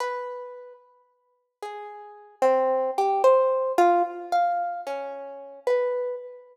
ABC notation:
X:1
M:9/8
L:1/8
Q:3/8=74
K:none
V:1 name="Orchestral Harp"
B3 z3 ^G3 | C2 G c2 F z f2 | ^C3 B2 z4 |]